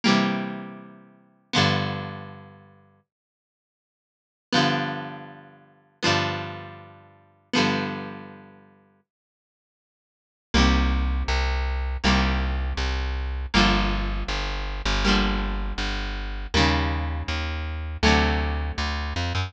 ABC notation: X:1
M:4/4
L:1/8
Q:1/4=160
K:G
V:1 name="Acoustic Guitar (steel)"
[C,E,G,_B,]8 | [G,,D,=F,B,]8 | z8 | [G,,D,=F,B,]8 |
[G,,D,=F,B,]8 | [G,,D,=F,B,]8 | z8 | [K:Gm] [C,E,G,B,]8 |
[C,E,G,B,]8 | [D,F,G,B,]8 | [D,F,G,B,]8 | [_D,E,G,B,]8 |
[C,D,^F,A,]8 |]
V:2 name="Electric Bass (finger)" clef=bass
z8 | z8 | z8 | z8 |
z8 | z8 | z8 | [K:Gm] C,,4 C,,4 |
C,,4 C,,4 | G,,,4 G,,,3 G,,,- | G,,,4 G,,,4 | E,,4 E,,4 |
D,,4 D,,2 F,, ^F,, |]